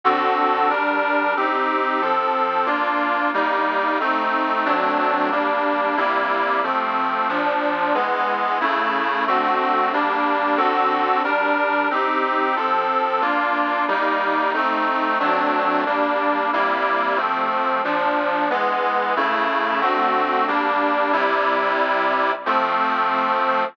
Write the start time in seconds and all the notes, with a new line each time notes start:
0.04 D3 C4 F#4 A4
0.70 G3 D4 A#4
1.36 C4 D#4 G4
2.01 F3 C4 A4
2.66 A#3 D4 F4
3.34 G3 A#3 D#4
4.00 A3 C4 D#4
4.65 F#3 A3 C4 D4
5.31 G3 A#3 D4
5.97 C3 G3 A#3 E4
6.63 F3 A3 C4
7.29 A#2 F3 D4
7.94 E3 G#3 B3
8.61 C#3 A3 E4
9.27 D3 A3 C4 F#4
9.93 G3 A#3 D4
10.57 D3 C4 F#4 A4
11.24 G3 D4 A#4
11.90 C4 D#4 G4
12.56 F3 C4 A4
13.21 A#3 D4 F4
13.88 G3 A#3 D#4
14.54 A3 C4 D#4
15.20 F#3 A3 C4 D4
15.86 G3 A#3 D4
16.53 C3 G3 A#3 E4
17.17 F3 A3 C4
17.84 A#2 F3 D4
18.50 E3 G#3 B3
19.16 C#3 A3 E4
19.81 D3 A3 C4 F#4
20.48 G3 A#3 D4
21.13 C3 G3 E4
22.46 F3 A3 C4